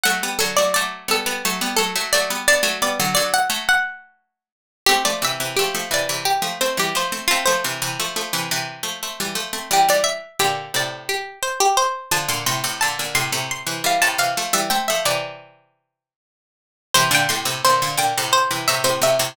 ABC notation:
X:1
M:7/8
L:1/16
Q:1/4=87
K:Amix
V:1 name="Harpsichord"
f2 A d d2 A4 A2 d2 | d2 d2 d f z f5 z2 | [K:Cmix] G d e2 G2 d2 G2 c G c2 | F c7 z6 |
G d e2 G2 d2 G2 c G c2 | a c' c'2 a2 c'2 c'2 f a f2 | e g e d7 z4 | c g c'2 c2 g2 c2 e c e2 |]
V:2 name="Harpsichord"
[F,A,] [G,B,] [D,F,] [F,A,] [F,A,]2 [G,B,] [G,B,] [F,A,] [G,B,] [F,A,] [F,A,] [F,A,] [G,B,] | [B,D] [F,A,] [G,B,] [D,F,] [D,F,]2 [F,A,]6 z2 | [K:Cmix] [A,C] [F,A,] [C,E,] [C,E,] [F,A,] [F,A,] [C,E,] [C,E,]2 [F,A,] [A,C] [E,G,] [F,A,] [A,C] | [A,C] [F,A,] [C,E,] [C,E,] [F,A,] [F,A,] [C,E,] [C,E,]2 [F,A,] [A,C] [E,G,] [F,A,] [A,C] |
[E,G,] [E,G,]2 z [B,,D,]2 [A,,C,]4 z4 | [D,F,] [B,,D,] [A,,C,] [A,,C,] [B,,D,] [B,,D,] [A,,C,] [A,,C,]2 [C,E,] [E,G,] [A,,C,] [C,E,] [F,A,] | [E,G,] [A,C] [F,A,] [C,E,]7 z4 | [C,E,] [B,,D,] [A,,C,] [A,,C,] [B,,D,] [B,,D,] [B,,D,] [A,,C,]2 [C,E,] [A,,C,] [A,,C,] [A,,C,] [A,,C,] |]